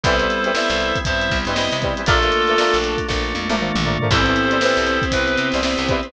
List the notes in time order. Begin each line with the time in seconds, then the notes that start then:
0.03 C2 E3 G3 B3 C4 E4 A4 B4 C5, kick, closed hi-hat
0.19 E3 G3 B4 C5, closed hi-hat
0.29 snare, closed hi-hat
0.44 E3 G3 B4 C5, closed hi-hat
0.54 E3 G3 B3 C4 E4 B4 C5 E5, snare
0.70 C2, closed hi-hat
0.80 closed hi-hat
0.95 kick, closed hi-hat
1.05 G2 G3 B3 C4 E4 G4 C5 E5, kick, closed hi-hat
1.21 closed hi-hat
1.31 C2, kick, closed hi-hat
1.45 G2 G3 B4 C5 D#5, closed hi-hat
1.49 E3
1.55 E3 G3 B3 C4 E4 B4 C5, snare
1.72 C3, closed hi-hat
1.82 E3 G3 B4 C5, kick, closed hi-hat
1.97 E3 G3 B4 C5, closed hi-hat
2.06 A#1 F3 A3 A#3 D4 F4 A4 A#4 D5, kick, closed hi-hat
2.22 F3 A3 A#4 D5, snare, closed hi-hat
2.32 closed hi-hat
2.47 F3 A3 A#4 D5, closed hi-hat
2.58 F3 A3 A#3 D4 F4 A#4 D5, snare
2.74 A#1, closed hi-hat
2.84 closed hi-hat
2.98 kick, closed hi-hat
3.08 A#1 A3 A#3 D4 F4 A4, kick, snare
3.34 F2, high tom
3.48 A#1 F3 A3 A#4 D5, high tom
3.59 F3 A3 A#3 D4 F4 A#4 D5, mid tom
3.75 A#1, mid tom
3.85 F3 A3 A#4 D5, floor tom
4.00 F3 A3 A#4 D5, floor tom
4.10 C2 E3 G3 B3 C4 E4 G4 A4 B4 C5, kick, crash
4.26 E3 G3 B4 C5, closed hi-hat
4.36 snare, closed hi-hat
4.50 E3 G3 B4 C5, closed hi-hat
4.61 E3 G3 B3 C4 E4 G4 B4 C5, snare
4.77 C2, closed hi-hat
4.87 snare, closed hi-hat
5.02 kick, closed hi-hat
5.11 C2 B3 C4 E4 G4 B4, kick, closed hi-hat
5.28 closed hi-hat
5.38 C3, closed hi-hat
5.52 C2 G3 B4 C5, closed hi-hat
5.56 E3
5.62 E3 G3 B3 C4 E4 G4 B4 C5, snare
5.78 C2, closed hi-hat
5.89 E3 G3 B4 C5, kick, closed hi-hat
6.03 G3 B4 C5, closed hi-hat
6.07 E3